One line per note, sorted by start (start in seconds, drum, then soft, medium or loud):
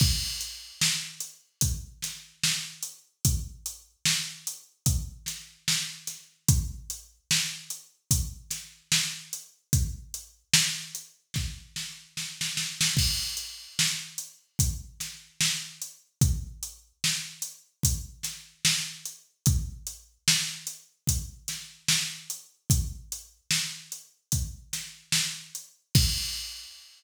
0.00 kick loud
0.00 crash loud
0.41 closed hi-hat medium
0.81 snare loud
1.20 closed hi-hat medium
1.61 kick medium
1.61 closed hi-hat loud
2.02 snare medium
2.02 closed hi-hat medium
2.43 snare medium
2.83 closed hi-hat medium
3.25 kick medium
3.25 closed hi-hat medium
3.66 closed hi-hat medium
4.05 snare loud
4.47 closed hi-hat medium
4.86 kick medium
4.86 closed hi-hat medium
5.26 snare medium
5.26 closed hi-hat medium
5.68 snare medium
6.07 snare soft
6.07 closed hi-hat medium
6.48 kick loud
6.48 closed hi-hat loud
6.90 closed hi-hat medium
7.31 snare loud
7.70 closed hi-hat medium
8.11 kick medium
8.11 closed hi-hat loud
8.51 snare soft
8.51 closed hi-hat medium
8.92 snare loud
9.33 closed hi-hat medium
9.73 kick medium
9.73 closed hi-hat medium
10.14 closed hi-hat medium
10.54 snare loud
10.95 closed hi-hat medium
11.34 kick medium
11.34 snare medium
11.76 snare medium
12.17 snare medium
12.41 snare medium
12.57 snare medium
12.81 snare loud
12.97 kick medium
12.97 crash loud
13.37 closed hi-hat medium
13.79 snare loud
14.18 closed hi-hat medium
14.59 kick medium
14.59 closed hi-hat medium
15.00 snare medium
15.00 closed hi-hat medium
15.41 snare loud
15.82 closed hi-hat medium
16.21 kick loud
16.21 closed hi-hat medium
16.63 closed hi-hat medium
17.04 snare medium
17.42 closed hi-hat medium
17.83 kick medium
17.83 closed hi-hat loud
18.23 snare medium
18.23 closed hi-hat medium
18.65 snare loud
19.05 closed hi-hat medium
19.46 kick loud
19.46 closed hi-hat medium
19.87 closed hi-hat medium
20.28 snare loud
20.67 closed hi-hat medium
21.07 kick medium
21.07 closed hi-hat medium
21.48 snare medium
21.48 closed hi-hat medium
21.89 snare loud
22.30 closed hi-hat medium
22.70 kick medium
22.70 closed hi-hat medium
23.12 closed hi-hat medium
23.51 snare medium
23.92 closed hi-hat medium
24.32 kick medium
24.32 closed hi-hat medium
24.73 snare medium
24.73 closed hi-hat medium
25.12 snare loud
25.55 closed hi-hat medium
25.95 kick loud
25.95 crash loud